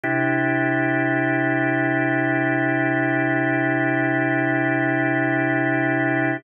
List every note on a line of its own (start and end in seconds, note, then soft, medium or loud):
0.04 6.37 C3 medium
0.04 6.37 D4 medium
0.04 6.37 E4 medium
0.04 6.37 G4 medium